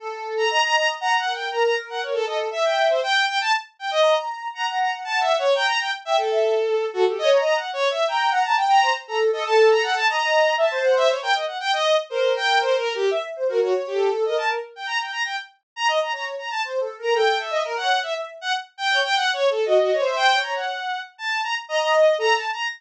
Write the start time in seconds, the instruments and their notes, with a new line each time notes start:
0.00 ocarina A4
0.37 violin A#5
0.50 ocarina D#5, violin A#5
0.64 violin A#5
0.76 violin A#5
1.00 ocarina F#5, violin A#5
1.17 violin F#5
1.25 ocarina A#4
1.34 violin G5
1.51 ocarina A#4, violin A#5
1.64 violin A#5
1.90 violin F#5
2.02 violin C#5
2.14 violin A4
2.26 ocarina A4, violin D#5
2.51 ocarina E5, violin E5
2.64 violin G5
2.89 violin C5
3.02 violin G5
3.27 violin G5
3.41 violin A5
3.79 violin G5
3.91 violin D#5
4.02 ocarina A#5
4.54 ocarina F#5, violin A#5
4.67 violin A#5
4.79 violin A#5
5.04 violin A5
5.20 violin E5
5.39 violin C#5
5.55 violin G5, ocarina A#5
5.66 violin A#5
5.80 violin G5
6.05 violin E5, ocarina G5
6.17 violin A4
6.31 ocarina E5
6.68 ocarina A4
6.93 violin F#4, ocarina A4
7.06 violin G4, ocarina A4
7.18 ocarina C#5, violin D#5
7.32 violin A#5
7.39 ocarina D#5
7.44 violin A#5
7.55 violin F#5
7.73 violin C#5
7.90 violin E5
8.07 violin G5, ocarina A#5
8.31 ocarina F#5, violin A#5
8.44 violin A5, ocarina A#5
8.57 ocarina G5
8.70 violin A#5
8.82 ocarina C5
9.07 ocarina A4, violin A#5
9.32 ocarina A4, violin D#5
9.46 violin A5
9.70 violin A#5
9.83 violin F#5
9.96 violin A5
10.08 ocarina D#5, violin A#5
10.58 ocarina E5, violin A5
10.71 ocarina C5
10.84 violin F#5
10.97 violin E5
11.09 violin C#5
11.22 ocarina A#4, violin G5
11.34 violin D#5
11.46 violin F#5
11.60 violin G5
11.73 violin D#5
12.09 ocarina A#4, violin C5
12.36 violin G5
12.61 violin C5
12.78 violin A#4
12.95 violin G4
13.11 ocarina E5
13.36 ocarina C5
13.49 violin F#4, ocarina A#4
13.62 violin F#4, ocarina C#5
13.87 violin G4
13.94 ocarina A4
14.25 ocarina A#4, violin D#5
14.37 violin A5
14.76 violin G5
14.86 violin A#5
15.00 violin G5
15.12 violin A#5
15.25 violin G5
15.76 violin A#5
15.88 violin D#5
16.01 violin A#5
16.12 ocarina C#5, violin A#5
16.38 violin A#5
16.50 violin A5
16.64 ocarina C5
16.80 ocarina A4
16.98 ocarina A#4, violin A#5
17.14 ocarina A4, violin G5
17.39 violin E5
17.51 ocarina D#5
17.65 ocarina A#4
17.76 ocarina C#5, violin F#5
18.03 violin E5
18.14 ocarina E5
18.41 violin F#5
18.78 violin G5
18.91 ocarina C#5
19.04 violin G5
19.15 violin F#5
19.33 violin C#5
19.50 violin A4
19.66 violin F#4, ocarina D#5
19.80 violin F#4
19.92 violin C#5
20.00 ocarina C5
20.05 violin E5
20.16 violin G5
20.34 ocarina C#5
20.42 violin A#5
20.55 violin F#5
21.18 violin A5
21.43 violin A#5
21.68 ocarina D#5, violin A#5
21.81 violin A#5
21.94 violin D#5
22.18 ocarina A4, violin A#5
22.35 violin A5
22.52 violin A#5